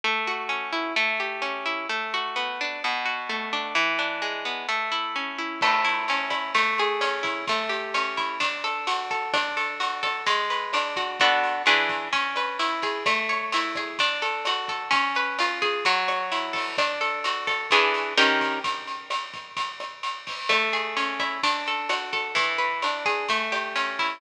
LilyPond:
<<
  \new Staff \with { instrumentName = "Acoustic Guitar (steel)" } { \time 4/4 \key a \major \tempo 4 = 129 a8 fis'8 cis'8 e'8 a8 g'8 cis'8 e'8 | a8 fis'8 b8 d'8 b,8 fis'8 a8 d'8 | e8 d'8 gis8 b8 a8 e'8 cis'8 e'8 | a8 e'8 cis'8 e'8 a8 gis'8 cis'8 e'8 |
a8 g'8 cis'8 e'8 d'8 a'8 fis'8 a'8 | d'8 a'8 fis'8 a'8 gis8 b'8 d'8 fis'8 | <b d' fis' a'>4 <e d' gis' b'>4 cis'8 b'8 e'8 gis'8 | a8 cis''8 e'8 gis'8 d'8 a'8 fis'8 a'8 |
cis'8 b'8 eis'8 gis'8 fis8 cis''8 e'8 a'8 | d'8 a'8 fis'8 a'8 <e d' gis' b'>4 <dis cis' g' ais'>4 | r1 | a8 gis'8 cis'8 e'8 d'8 a'8 fis'8 a'8 |
e8 b'8 d'8 gis'8 a8 g'8 cis'8 e'8 | }
  \new DrumStaff \with { instrumentName = "Drums" } \drummode { \time 4/4 r4 r4 r4 r4 | r4 r4 r4 r4 | r4 r4 r4 r4 | <cymc bd ss>8 hh8 hh8 <hh bd ss>8 <hh bd>8 hh8 <hh ss>8 <hh bd>8 |
<hh bd>8 hh8 <hh ss>8 <hh bd>8 <hh bd>8 <hh ss>8 hh8 <hh bd>8 | <hh bd ss>8 hh8 hh8 <hh bd ss>8 <hh bd>8 hh8 <hh ss>8 <hh bd>8 | <hh bd>8 hh8 <hh ss>8 <hh bd>8 <hh bd>8 <hh ss>8 hh8 <hh bd>8 | <hh bd ss>8 hh8 hh8 <hh bd ss>8 <hh bd>8 hh8 <hh ss>8 <hh bd>8 |
<hh bd>8 hh8 <hh ss>8 <hh bd>8 <hh bd>8 <hh ss>8 hh8 <hho bd>8 | <hh bd ss>8 hh8 hh8 <hh bd ss>8 <hh bd>8 hh8 <hh ss>8 <hh bd>8 | <hh bd>8 hh8 <hh ss>8 <hh bd>8 <hh bd>8 <hh ss>8 hh8 <hho bd>8 | <hh bd ss>8 hh8 hh8 <hh bd ss>8 <hh bd>8 hh8 <hh ss>8 <hh bd>8 |
<hh bd>8 hh8 <hh ss>8 <hh bd>8 <hh bd>8 <hh ss>8 hh8 <hho bd>8 | }
>>